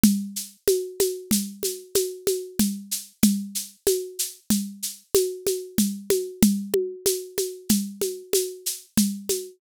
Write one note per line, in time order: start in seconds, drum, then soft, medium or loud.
0.03 low conga loud
0.03 shaker medium
0.36 shaker medium
0.68 high conga medium
0.68 shaker medium
1.00 high conga medium
1.00 shaker medium
1.31 low conga medium
1.31 shaker medium
1.63 high conga medium
1.63 shaker medium
1.95 high conga medium
1.95 shaker medium
2.27 high conga medium
2.27 shaker medium
2.59 low conga medium
2.59 shaker medium
2.91 shaker medium
3.23 low conga loud
3.23 shaker medium
3.55 shaker medium
3.87 high conga medium
3.87 shaker medium
4.19 shaker medium
4.50 low conga medium
4.50 shaker medium
4.83 shaker medium
5.14 high conga medium
5.14 shaker medium
5.47 high conga medium
5.47 shaker medium
5.78 low conga medium
5.78 shaker medium
6.10 high conga medium
6.10 shaker medium
6.42 low conga loud
6.42 shaker medium
6.74 high conga medium
7.06 high conga medium
7.06 shaker medium
7.38 high conga medium
7.38 shaker medium
7.69 low conga medium
7.69 shaker medium
8.01 high conga medium
8.01 shaker medium
8.33 high conga medium
8.33 shaker medium
8.66 shaker medium
8.97 low conga medium
8.97 shaker medium
9.29 high conga medium
9.29 shaker medium